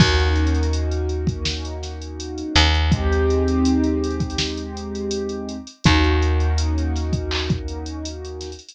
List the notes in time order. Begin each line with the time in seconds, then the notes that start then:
0.00 D#2 A#3 C#4 D#4 F#4, kick, crash
0.20 closed hi-hat
0.36 closed hi-hat
0.47 closed hi-hat
0.55 closed hi-hat
0.63 closed hi-hat
0.73 closed hi-hat
0.91 closed hi-hat
1.09 closed hi-hat
1.27 kick, closed hi-hat
1.45 snare
1.65 closed hi-hat
1.83 snare, closed hi-hat
2.02 closed hi-hat
2.20 closed hi-hat
2.38 closed hi-hat
2.55 D#2, closed hi-hat
2.74 closed hi-hat
2.92 G#3 C4 D#4 G4, kick, closed hi-hat
3.12 closed hi-hat
3.30 closed hi-hat
3.48 closed hi-hat
3.65 closed hi-hat
3.84 closed hi-hat
4.04 closed hi-hat
4.11 closed hi-hat
4.20 kick, closed hi-hat
4.30 closed hi-hat
4.38 snare
4.57 closed hi-hat
4.77 closed hi-hat
4.95 closed hi-hat
5.11 closed hi-hat
5.29 closed hi-hat
5.49 closed hi-hat
5.67 closed hi-hat
5.84 D#2 A#3 C#4 D#4 F#4, kick, closed hi-hat
6.04 closed hi-hat
6.22 closed hi-hat
6.40 closed hi-hat
6.58 closed hi-hat
6.78 closed hi-hat
6.96 snare, closed hi-hat
7.13 kick, closed hi-hat
7.31 clap
7.50 kick, closed hi-hat
7.68 closed hi-hat
7.86 closed hi-hat
8.05 closed hi-hat
8.25 closed hi-hat
8.41 snare, closed hi-hat
8.52 closed hi-hat
8.59 closed hi-hat
8.69 closed hi-hat